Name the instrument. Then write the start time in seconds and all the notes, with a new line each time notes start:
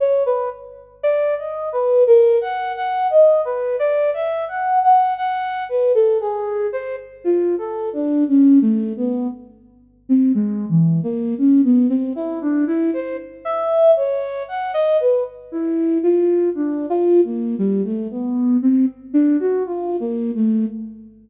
flute
0.00 C#5
0.26 B4
1.03 D5
1.38 D#5
1.72 B4
2.07 A#4
2.41 F#5
2.76 F#5
3.10 D#5
3.45 B4
3.79 D5
4.14 E5
4.48 F#5
4.83 F#5
5.17 F#5
5.69 B4
5.95 A4
6.21 G#4
6.73 C5
7.24 F4
7.58 A4
7.93 D4
8.28 C#4
8.62 A3
8.97 B3
10.09 C4
10.35 G#3
10.69 E3
11.03 A#3
11.38 C#4
11.64 B3
11.89 C4
12.16 E4
12.41 D4
12.67 E4
12.94 C5
13.45 E5
13.97 C#5
14.48 F#5
14.74 D#5
15.00 B4
15.52 E4
16.03 F4
16.55 D4
16.90 F4
17.24 A#3
17.59 G3
17.84 A3
18.10 B3
18.62 C4
19.14 D4
19.40 F#4
19.66 F4
20.00 A#3
20.35 A3